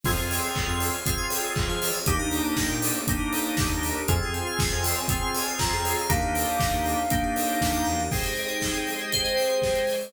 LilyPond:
<<
  \new Staff \with { instrumentName = "Ocarina" } { \time 4/4 \key f \minor \tempo 4 = 119 r1 | r1 | aes''2. bes''4 | f''1 |
\key aes \major r1 | }
  \new Staff \with { instrumentName = "Electric Piano 2" } { \time 4/4 \key f \minor r1 | r1 | r1 | r1 |
\key aes \major r2 c''2 | }
  \new Staff \with { instrumentName = "Drawbar Organ" } { \time 4/4 \key f \minor <c' f' aes'>2 <c' f' aes'>2 | <bes d' ees' g'>2 <bes d' ees' g'>2 | <c' f' aes'>2 <c' f' aes'>2 | <bes d' ees' g'>2 <bes d' ees' g'>2 |
\key aes \major <aes' c'' ees'' g''>1 | }
  \new Staff \with { instrumentName = "Tubular Bells" } { \time 4/4 \key f \minor aes'16 c''16 f''16 aes''16 c'''16 f'''16 aes'16 c''16 f''16 aes''16 c'''16 f'''16 aes'16 c''16 f''16 aes''16 | g'16 bes'16 d''16 ees''16 g''16 bes''16 d'''16 ees'''16 g'16 bes'16 d''16 ees''16 g''16 bes''16 d'''16 ees'''16 | f'16 aes'16 c''16 f''16 aes''16 c'''16 f'16 aes'16 c''16 f''16 aes''16 c'''16 f'16 aes'16 c''16 f''16 | ees'16 g'16 bes'16 d''16 ees''16 g''16 bes''16 d'''16 ees'16 g'16 bes'16 d''16 ees''16 g''16 bes''16 d'''16 |
\key aes \major aes'16 c''16 ees''16 g''16 c'''16 ees'''16 g'''16 aes'16 c''16 ees''16 g''16 c'''16 ees'''16 g'''16 aes'16 c''16 | }
  \new Staff \with { instrumentName = "Synth Bass 1" } { \clef bass \time 4/4 \key f \minor f,16 f,4 f,2 f8. | ees,16 ees,4 bes,2 ees,8. | f,16 f,4 f,2 f,8. | ees,16 ees,4 ees,4.~ ees,16 ees,8 e,8 |
\key aes \major r1 | }
  \new Staff \with { instrumentName = "String Ensemble 1" } { \time 4/4 \key f \minor <c' f' aes'>1 | <bes d' ees' g'>1 | <c' f' aes'>1 | <bes d' ees' g'>1 |
\key aes \major <aes c' ees' g'>2 <aes c' g' aes'>2 | }
  \new DrumStaff \with { instrumentName = "Drums" } \drummode { \time 4/4 <cymc bd>8 hho8 <hc bd>8 hho8 <hh bd>8 hho8 <hc bd>8 hho8 | <hh bd>8 hho8 <bd sn>8 hho8 <hh bd>8 hho8 <bd sn>8 hho8 | <hh bd>8 hh8 <bd sn>8 hho8 <hh bd>8 hho8 <bd sn>8 hho8 | <hh bd>8 hho8 <bd sn>8 hho8 <hh bd>8 hho8 <bd sn>8 sn8 |
<cymc bd>16 hh16 hho16 hh16 <bd sn>16 hh16 hho16 hh16 <hh bd>16 hh16 hho16 hh16 <bd sn>16 hh16 hho16 hho16 | }
>>